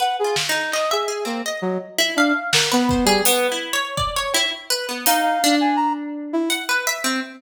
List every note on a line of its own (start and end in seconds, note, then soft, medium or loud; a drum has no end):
0.00 0.20 B4 medium
0.00 0.17 F#5 medium
0.19 0.36 G#4 medium
0.24 0.46 F4 soft
0.36 snare medium
0.49 0.71 D#4 medium
0.72 0.90 D#5 medium
0.72 clap medium
0.91 1.25 G#4 medium
0.91 1.07 E5 medium
1.08 1.24 G#4 medium
1.25 1.42 A#3 medium
1.25 1.41 C4 soft
1.46 1.95 D#5 medium
1.62 1.78 F#3 medium
1.98 2.15 E4 loud
2.16 2.33 D4 medium
2.16 2.50 F5 medium
2.53 2.69 A#4 medium
2.53 2.69 F#5 medium
2.53 snare medium
2.72 3.05 B3 loud
2.72 2.88 B4 medium
2.89 3.07 C5 medium
2.89 kick medium
3.05 3.21 G3 loud
3.05 3.23 G#4 loud
3.25 3.47 B3 loud
3.25 closed hi-hat loud
3.52 3.73 E4 medium
3.73 3.95 C#5 loud
3.97 4.14 D5 medium
3.97 kick medium
4.16 4.33 C#5 loud
4.34 4.51 E4 loud
4.34 cowbell medium
4.70 4.86 B4 loud
4.89 5.05 B3 medium
5.06 5.39 D#4 loud
5.06 5.22 F5 medium
5.06 closed hi-hat loud
5.22 5.55 F5 medium
5.44 6.41 D4 loud
5.61 5.77 G#5 medium
5.76 5.93 A#5 medium
6.33 6.49 E4 loud
6.50 6.66 F#5 loud
6.50 closed hi-hat soft
6.69 6.85 B4 loud
6.87 7.03 E5 loud
7.04 7.20 C4 medium